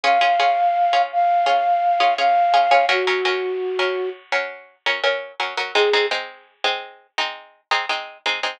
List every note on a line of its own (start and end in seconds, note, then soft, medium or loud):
0.03 0.18 C#4 medium
0.03 0.18 F4 medium
0.03 0.18 G#4 medium
0.03 1.02 F5 medium
0.21 0.35 C#4 medium
0.21 0.35 F4 medium
0.21 0.35 G#4 medium
0.39 0.82 C#4 medium
0.39 0.82 F4 medium
0.39 0.82 G#4 medium
0.93 1.36 C#4 medium
0.93 1.36 F4 medium
0.93 1.36 G#4 medium
1.12 2.14 F5 medium
1.46 1.89 C#4 medium
1.46 1.89 F4 medium
1.46 1.89 G#4 medium
2.00 2.14 C#4 medium
2.00 2.14 F4 medium
2.00 2.14 G#4 medium
2.18 2.47 C#4 medium
2.18 2.47 F4 medium
2.18 2.47 G#4 medium
2.18 2.86 F5 medium
2.54 2.68 C#4 medium
2.54 2.68 F4 medium
2.54 2.68 G#4 medium
2.71 2.85 C#4 medium
2.71 2.85 F4 medium
2.71 2.85 G#4 medium
2.89 3.03 F#3 medium
2.89 3.03 C#4 medium
2.89 4.09 F#4 medium
2.89 3.03 A#4 medium
3.07 3.21 F#3 medium
3.07 3.21 C#4 medium
3.07 3.21 A#4 medium
3.25 3.68 F#3 medium
3.25 3.68 C#4 medium
3.25 3.68 A#4 medium
3.79 4.22 F#3 medium
3.79 4.22 C#4 medium
3.79 4.22 A#4 medium
4.32 4.75 F#3 medium
4.32 4.75 C#4 medium
4.32 4.75 A#4 medium
4.86 5.00 F#3 medium
4.86 5.00 C#4 medium
4.86 5.00 A#4 medium
5.04 5.32 F#3 medium
5.04 5.32 C#4 medium
5.04 5.32 A#4 medium
5.40 5.54 F#3 medium
5.40 5.54 C#4 medium
5.40 5.54 A#4 medium
5.57 5.72 F#3 medium
5.57 5.72 C#4 medium
5.57 5.72 A#4 medium
5.75 5.89 G#3 medium
5.75 5.89 C4 medium
5.75 5.89 D#4 medium
5.75 6.06 G#4 medium
5.93 6.08 G#3 medium
5.93 6.08 C4 medium
5.93 6.08 D#4 medium
6.11 6.54 G#3 medium
6.11 6.54 C4 medium
6.11 6.54 D#4 medium
6.64 7.07 G#3 medium
6.64 7.07 C4 medium
6.64 7.07 D#4 medium
7.18 7.61 G#3 medium
7.18 7.61 C4 medium
7.18 7.61 D#4 medium
7.71 7.85 G#3 medium
7.71 7.85 C4 medium
7.71 7.85 D#4 medium
7.89 8.18 G#3 medium
7.89 8.18 C4 medium
7.89 8.18 D#4 medium
8.26 8.40 G#3 medium
8.26 8.40 C4 medium
8.26 8.40 D#4 medium
8.43 8.57 G#3 medium
8.43 8.57 C4 medium
8.43 8.57 D#4 medium